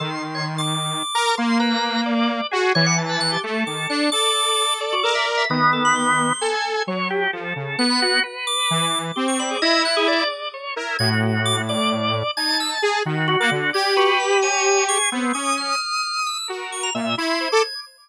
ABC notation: X:1
M:6/8
L:1/16
Q:3/8=87
K:none
V:1 name="Lead 2 (sawtooth)"
^D,10 ^A2 | ^A,10 ^F2 | E,6 A,2 ^D,2 =D2 | A8 ^A4 |
^D,8 A4 | ^F,4 =F,2 ^C,2 B,4 | z4 E,4 C4 | E6 z4 ^A2 |
A,,12 | ^D4 ^G2 ^D,3 ^A, =D,2 | G12 | B,2 ^C4 z6 |
^F4 ^A,,2 E3 =A z2 |]
V:2 name="Drawbar Organ"
A z2 ^c z d'7 | z2 B4 z6 | ^c ^f z B ^f' G z2 d'2 f'2 | d'6 z ^F A e z e |
^d2 A b c'5 z3 | z8 ^f'4 | z2 d'5 z G ^c' b ^G | ^d2 ^f' ^G =d2 z6 |
^g' z3 d' z d'2 z4 | ^g'2 e' z5 ^F d' z2 | ^g'2 ^F2 b2 ^g4 ^c'2 | z2 ^c'2 f'6 e'2 |
z2 ^c' ^a z2 ^g'6 |]
V:3 name="Drawbar Organ"
c'6 z4 ^a2 | c'2 ^a4 d4 ^G2 | d'2 a4 A6 | d6 d6 |
B,8 ^g4 | ^c2 G2 A5 b ^F2 | B6 z4 d2 | e'2 z2 d4 ^c2 E2 |
^F6 d6 | a6 ^F2 F4 | d2 B4 ^c4 ^G2 | C2 ^d'10 |
^A4 e2 c'2 c d' z2 |]